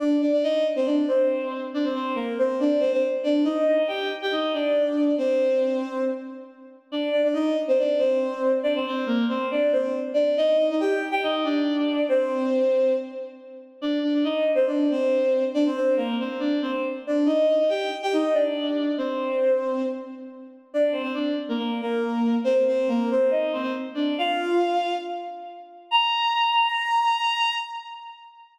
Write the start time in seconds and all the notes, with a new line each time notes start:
0.00 D4 D5
0.21 D4 D5
0.32 D4 D5
0.43 D#4 D#5
0.76 C4 C5
0.85 D4 D5
1.08 C4 C5
1.74 D4 D5
1.84 C4 C5
1.94 C4 C5
2.15 A#3 A#4
2.39 C4 C5
2.60 D4 D5
2.80 C4 C5
2.92 C4 C5
3.23 D4 D5
3.45 D#4 D#5
3.67 D#4 D#5
3.78 D#4 D#5
3.88 G4 G5
4.22 G4 G5
4.32 D#4 D#5
4.53 D4 D5
5.18 C4 C5
6.92 D4 D5
7.11 D4 D5
7.24 D4 D5
7.33 D#4 D#5
7.68 C4 C5
7.79 D4 D5
7.98 C4 C5
8.63 D4 D5
8.75 C4 C5
8.86 C4 C5
9.06 A#3 A#4
9.29 C4 C5
9.51 D4 D5
9.72 C4 C5
9.82 C4 C5
10.14 D4 D5
10.37 D#4 D#5
10.57 D#4 D#5
10.70 D#4 D#5
10.80 G4 G5
11.11 G4 G5
11.23 D#4 D#5
11.44 D4 D5
12.09 C4 C5
13.82 D4 D5
14.03 D4 D5
14.14 D4 D5
14.24 D#4 D#5
14.55 C4 C5
14.67 D4 D5
14.91 C4 C5
15.54 D4 D5
15.66 C4 C5
15.76 C4 C5
15.96 A#3 A#4
16.20 C4 C5
16.39 D4 D5
16.62 C4 C5
16.71 C4 C5
17.07 D4 D5
17.26 D#4 D#5
17.48 D#4 D#5
17.60 D#4 D#5
17.69 G4 G5
18.03 G4 G5
18.13 D#4 D#5
18.34 D4 D5
18.98 C4 C5
20.74 D4 D5
20.92 C4 C5
21.03 C4 C5
21.14 D4 D5
21.49 A#3 A#4
21.58 A#3 A#4
21.81 A#3 A#4
22.44 C4 C5
22.54 C4 C5
22.68 C4 C5
22.88 A#3 A#4
23.11 C4 C5
23.31 D#4 D#5
23.53 C4 C5
23.62 C4 C5
23.94 D4 D5
24.18 F4 F5
25.91 A#5